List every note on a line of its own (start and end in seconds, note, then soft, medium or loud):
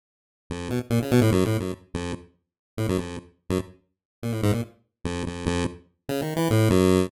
0.50 0.69 F2 medium
0.70 0.80 B2 medium
0.90 0.99 A#2 medium
1.02 1.11 C#3 medium
1.11 1.21 B2 loud
1.21 1.31 A2 loud
1.32 1.44 F#2 loud
1.45 1.58 A2 medium
1.60 1.72 F#2 medium
1.94 2.13 F2 medium
2.77 2.87 A2 medium
2.89 2.98 F#2 medium
2.98 3.17 F2 medium
3.50 3.59 F#2 medium
4.23 4.32 A#2 medium
4.32 4.41 A2 medium
4.43 4.52 G#2 loud
4.52 4.61 A#2 medium
5.04 5.23 F2 medium
5.26 5.45 F2 medium
5.46 5.64 F2 loud
6.09 6.21 C#3 medium
6.22 6.34 D#3 medium
6.36 6.49 E3 medium
6.50 6.69 A2 loud
6.70 7.07 F#2 loud